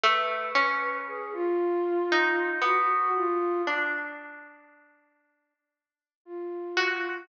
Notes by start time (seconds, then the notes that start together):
0.04 A3 B4
0.55 C#4
1.07 G#4
1.33 F4
2.12 D#4
2.62 B3 F#4
3.15 F4
3.67 D4
6.25 F4
6.77 F#4